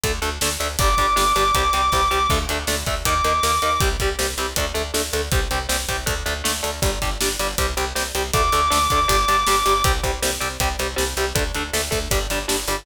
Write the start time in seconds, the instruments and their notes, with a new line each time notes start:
0.04 electric bass (finger) D2, overdriven guitar A3 D4, kick, closed hi-hat
0.22 electric bass (finger) D2, overdriven guitar A3 D4, closed hi-hat
0.41 electric bass (finger) D2, overdriven guitar A3 D4, snare
0.60 electric bass (finger) D2, overdriven guitar A3 D4, closed hi-hat
0.79 electric bass (finger) G1, overdriven guitar G3 D4, distortion guitar D6, kick, closed hi-hat
0.98 electric bass (finger) G1, overdriven guitar G3 D4, kick, closed hi-hat
1.16 electric bass (finger) G1, overdriven guitar G3 D4, snare
1.36 electric bass (finger) G1, overdriven guitar G3 D4, closed hi-hat
1.55 electric bass (finger) C2, overdriven guitar G3 C4, kick, closed hi-hat
1.73 electric bass (finger) C2, overdriven guitar G3 C4, closed hi-hat
1.92 electric bass (finger) C2, overdriven guitar G3 C4, kick, snare
2.11 electric bass (finger) C2, overdriven guitar G3 C4
2.30 electric bass (finger) D2, overdriven guitar A3 D4, kick, crash
2.49 electric bass (finger) D2, overdriven guitar A3 D4, closed hi-hat
2.67 electric bass (finger) D2, overdriven guitar A3 D4, snare
2.86 electric bass (finger) D2, overdriven guitar A3 D4, kick, closed hi-hat
3.05 electric bass (finger) D#2, overdriven guitar A#3 D#4, distortion guitar D6, kick, closed hi-hat
3.24 electric bass (finger) D#2, overdriven guitar A#3 D#4, closed hi-hat
3.43 electric bass (finger) D#2, overdriven guitar A#3 D#4, snare
3.62 electric bass (finger) D#2, overdriven guitar A#3 D#4, closed hi-hat
3.80 electric bass (finger) C2, overdriven guitar G3 C4, kick, closed hi-hat
4.00 electric bass (finger) C2, overdriven guitar G3 C4, kick, closed hi-hat
4.19 electric bass (finger) C2, overdriven guitar G3 C4, snare
4.38 electric bass (finger) C2, overdriven guitar G3 C4, closed hi-hat
4.56 electric bass (finger) D2, overdriven guitar A3 D4, kick, closed hi-hat
4.74 electric bass (finger) D2, overdriven guitar A3 D4, closed hi-hat
4.94 electric bass (finger) D2, overdriven guitar A3 D4, snare
5.13 electric bass (finger) D2, overdriven guitar A3 D4, closed hi-hat
5.32 electric bass (finger) C2, overdriven guitar G3 C4, kick, closed hi-hat
5.51 electric bass (finger) C2, overdriven guitar G3 C4, closed hi-hat
5.69 electric bass (finger) C2, overdriven guitar G3 C4, snare
5.89 electric bass (finger) C2, overdriven guitar G3 C4, kick, closed hi-hat
6.06 electric bass (finger) D2, overdriven guitar A3 D4, kick, closed hi-hat
6.26 electric bass (finger) D2, overdriven guitar A3 D4, closed hi-hat
6.44 electric bass (finger) D2, overdriven guitar A3 D4, snare
6.63 electric bass (finger) D2, overdriven guitar A3 D4, closed hi-hat
6.82 electric bass (finger) G1, overdriven guitar G3 D4, kick, closed hi-hat
7.02 electric bass (finger) G1, overdriven guitar G3 D4, kick, closed hi-hat
7.21 electric bass (finger) G1, overdriven guitar G3 D4, snare
7.39 electric bass (finger) G1, overdriven guitar G3 D4, closed hi-hat
7.58 electric bass (finger) C2, overdriven guitar G3 C4, kick, closed hi-hat
7.77 electric bass (finger) C2, overdriven guitar G3 C4, closed hi-hat
7.95 electric bass (finger) C2, overdriven guitar G3 C4, snare
8.15 electric bass (finger) C2, overdriven guitar G3 C4, closed hi-hat
8.33 electric bass (finger) D2, overdriven guitar A3 D4, distortion guitar D6, kick, closed hi-hat
8.52 electric bass (finger) D2, overdriven guitar A3 D4, closed hi-hat
8.70 electric bass (finger) D2, overdriven guitar A3 D4, snare
8.90 electric bass (finger) D2, overdriven guitar A3 D4, kick, closed hi-hat
9.08 electric bass (finger) G1, overdriven guitar G3 D4, kick, closed hi-hat
9.28 electric bass (finger) G1, overdriven guitar G3 D4, closed hi-hat
9.47 electric bass (finger) G1, overdriven guitar G3 D4, snare
9.66 electric bass (finger) G1, overdriven guitar G3 D4, closed hi-hat
9.84 electric bass (finger) C2, overdriven guitar G3 C4, kick, closed hi-hat
10.03 electric bass (finger) C2, overdriven guitar G3 C4, kick, closed hi-hat
10.22 electric bass (finger) C2, overdriven guitar G3 C4, snare
10.40 electric bass (finger) C2, overdriven guitar G3 C4, closed hi-hat
10.60 electric bass (finger) C2, overdriven guitar G3 C4, kick, closed hi-hat
10.79 electric bass (finger) C2, overdriven guitar G3 C4, closed hi-hat
10.96 electric bass (finger) C2, overdriven guitar G3 C4, snare
11.17 electric bass (finger) C2, overdriven guitar G3 C4, closed hi-hat
11.35 electric bass (finger) D2, overdriven guitar A3 D4, kick, closed hi-hat
11.55 electric bass (finger) D2, overdriven guitar A3 D4, closed hi-hat
11.73 electric bass (finger) D2, overdriven guitar A3 D4, snare
11.91 electric bass (finger) D2, overdriven guitar A3 D4, kick, closed hi-hat
12.11 electric bass (finger) G1, overdriven guitar G3 D4, kick, closed hi-hat
12.30 electric bass (finger) G1, overdriven guitar G3 D4, closed hi-hat
12.48 electric bass (finger) G1, overdriven guitar G3 D4, snare
12.68 electric bass (finger) G1, overdriven guitar G3 D4, closed hi-hat